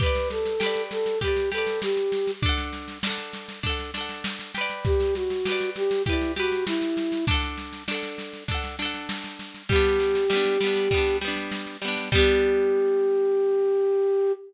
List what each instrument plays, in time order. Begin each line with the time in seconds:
0.00 orchestral harp G4 B4, flute B4, kick, snare
0.06 orchestral harp D5
0.15 snare
0.30 flute A4, snare
0.45 snare
0.60 orchestral harp G4 B4, snare
0.66 orchestral harp D5
0.76 snare
0.91 flute A4, snare
1.06 snare
1.21 orchestral harp G4 B4, flute G4, kick, snare
1.28 orchestral harp D5
1.36 snare
1.52 orchestral harp G4 B4, flute A4, snare
1.58 orchestral harp D5
1.67 snare
1.82 flute G4, snare
1.97 snare
2.12 snare
2.27 snare
2.42 orchestral harp D4 A4, kick, snare
2.49 orchestral harp F#5
2.58 snare
2.73 snare
2.88 snare
3.03 orchestral harp D4 A4, snare
3.10 orchestral harp F#5
3.18 snare
3.33 snare
3.48 snare
3.63 orchestral harp D4 A4, kick, snare
3.70 orchestral harp F#5
3.79 snare
3.94 orchestral harp D4 A4, snare
4.01 orchestral harp F#5
4.09 snare
4.24 snare
4.39 snare
4.55 orchestral harp G4 B4, snare
4.61 orchestral harp D5
4.70 snare
4.85 flute G4, kick, snare
5.00 snare
5.15 flute F#4, snare
5.30 snare
5.45 orchestral harp G4 B4, snare
5.52 orchestral harp D5
5.61 snare
5.76 flute G4, snare
5.91 snare
6.06 flute E4, orchestral harp G4 B4, kick, snare
6.13 orchestral harp D5
6.21 snare
6.36 flute F#4, orchestral harp G4 B4, snare
6.43 orchestral harp D5
6.52 snare
6.67 flute E4, snare
6.82 snare
6.97 snare
7.12 snare
7.27 orchestral harp D4 A4, kick, snare
7.34 orchestral harp F#5
7.42 snare
7.58 snare
7.73 snare
7.88 orchestral harp D4 A4, snare
7.95 orchestral harp F#5
8.03 snare
8.18 snare
8.33 snare
8.48 orchestral harp D4 A4, kick, snare
8.55 orchestral harp F#5
8.64 snare
8.79 orchestral harp D4 A4, snare
8.85 orchestral harp F#5
8.94 snare
9.09 snare
9.24 snare
9.39 snare
9.55 snare
9.69 orchestral harp G3 B3, flute G4, kick, snare
9.76 orchestral harp D4
9.85 snare
10.00 snare
10.15 snare
10.30 orchestral harp G3 B3, snare
10.36 orchestral harp D4
10.45 snare
10.61 orchestral harp G3 B3, snare
10.67 orchestral harp D4
10.76 snare
10.91 orchestral harp G3 B3, kick, snare
10.97 orchestral harp D4
11.06 snare
11.21 orchestral harp G3 B3, snare
11.28 orchestral harp D4
11.36 snare
11.52 snare
11.67 snare
11.82 orchestral harp G3 B3, snare
11.88 orchestral harp D4
11.97 snare
12.12 orchestral harp G3 B3, flute G4, kick, crash
12.18 orchestral harp D4